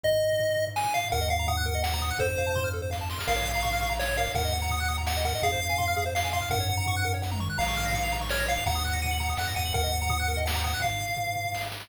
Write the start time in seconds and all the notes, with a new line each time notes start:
0.04 D#5, kick, floor tom
0.11 floor tom
0.22 floor tom
0.32 floor tom
0.39 floor tom
0.49 floor tom
0.56 floor tom
0.67 floor tom
0.76 G#5, snare
0.84 floor tom
0.94 F5, floor tom
1.04 floor tom
1.10 D#2 A#4 F#5, kick, floor tom
1.20 D#5, floor tom
1.29 F5 F#5, floor tom
1.39 A#5, floor tom
1.47 F#5 D#6, floor tom
1.56 F#6, floor tom
1.66 A#4, floor tom
1.74 D#5, floor tom
1.84 F#5, snare
1.93 A#5, floor tom
2.01 D#6, floor tom
2.10 F#6, floor tom
2.18 F2 A4 C5, kick, floor tom
2.29 C5, floor tom
2.38 F5, floor tom
2.47 A5, floor tom
2.55 C6, floor tom
2.64 F6, floor tom
2.73 A4, floor tom
2.81 C5, floor tom
2.90 F5, kick, snare
3.01 A5
3.10 C6, snare
3.19 F6, snare
3.27 A#1 A#4 F5, kick, crash
3.36 C#5, floor tom
3.45 F5, floor tom
3.55 A#5, floor tom
3.62 C#6, floor tom
3.71 F6, floor tom
3.81 C#6, floor tom
3.90 A#5, floor tom
3.99 C#5 F5, snare
4.08 C#5, floor tom
4.16 A#4 F5, floor tom
4.26 C#5, floor tom
4.35 D#2 A#4 F#5, kick, floor tom
4.43 D#5, floor tom
4.52 F#5, floor tom
4.62 A#5, floor tom
4.69 D#6, floor tom
4.80 F#6, floor tom
4.88 D#6, floor tom
4.98 A#5, floor tom
5.07 F#5, snare
5.17 D#5, floor tom
5.25 A#4 F#5, floor tom
5.33 D#5, floor tom
5.42 F2 G#4 F5, kick, floor tom
5.52 C5, floor tom
5.61 F5
5.70 G#5, floor tom
5.78 C6, floor tom
5.88 F6, floor tom
5.96 G#4, floor tom
6.06 C5, floor tom
6.15 F5, snare
6.23 G#5, floor tom
6.33 F5 C6, floor tom
6.42 F6, floor tom
6.50 F#2 A#4 F#5, kick, floor tom
6.59 C#5, floor tom
6.69 F#5, floor tom
6.77 A#5, floor tom
6.86 C#6, floor tom
6.95 F#6, floor tom
7.04 A#4, floor tom
7.14 C#5, floor tom
7.22 F#5, kick, snare
7.31 A#5, high tom
7.39 C#6, mid tom
7.50 F#6
7.58 A#1 F5 A#5, kick, crash
7.68 C#6, floor tom
7.77 F6, floor tom
7.85 A#6, floor tom
7.93 C#7, floor tom
8.03 F7, floor tom
8.12 A#5, floor tom
8.21 C#6, floor tom
8.29 C#5 F6, snare
8.39 A#6, floor tom
8.48 F5 C#7, floor tom
8.57 F7, floor tom
8.66 D#2 F#5 A#5, kick, floor tom
8.75 D#6, floor tom
8.84 F#6, floor tom
8.93 A#6, floor tom
9.02 D#7, floor tom
9.11 F#7, floor tom
9.20 A#5, floor tom
9.28 D#6, floor tom
9.37 F2 F#5 F#6, snare
9.47 A#6, floor tom
9.56 E2 F#5 D#7, floor tom
9.65 F#7, floor tom
9.74 D#2 A#4 F#5, kick, floor tom
9.83 D#5, floor tom
9.92 F#5, floor tom
10.01 A#5, floor tom
10.09 D#6, floor tom
10.19 F#6, floor tom
10.28 A#4
10.37 D#5, floor tom
10.46 F#5, snare
10.53 A#5, floor tom
10.64 F#5 D#6, floor tom
10.73 F#6, floor tom
10.80 F5, kick, floor tom
10.91 floor tom
11.00 floor tom
11.08 floor tom
11.17 floor tom
11.27 floor tom
11.36 floor tom
11.45 floor tom
11.52 kick, snare
11.61 snare
11.72 snare
11.80 snare